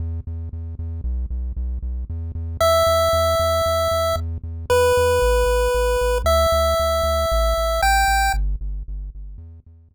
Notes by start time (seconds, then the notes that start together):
0.00 E2
0.27 E2
0.53 E2
0.79 E2
1.04 B1
1.30 B1
1.57 B1
1.82 B1
2.10 E2
2.35 E2
2.61 E2 E5
2.87 E2
3.13 E2
3.39 E2
3.66 E2
3.91 E2
4.16 E2
4.43 E2
4.70 E2 B4
4.97 E2
5.22 A1
5.46 A1
5.74 A1
6.01 A1
6.24 D2 E5
6.52 D2
6.80 D2
7.03 D2
7.32 A1
7.58 A1
7.82 A1 G5
8.08 A1
8.34 G1
8.61 G1
8.88 G1
9.15 G1
9.38 E2
9.66 E2
9.91 E2